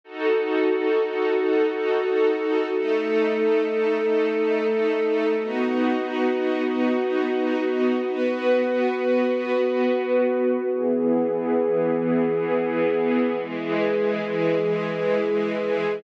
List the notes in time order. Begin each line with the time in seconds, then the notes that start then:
0.04 D#4 F#4 A4
2.72 A3 D#4 A4
5.37 B3 D#4 F#4
8.04 B3 F#4 B4
10.70 E3 B3 G#4
13.36 E3 G#3 G#4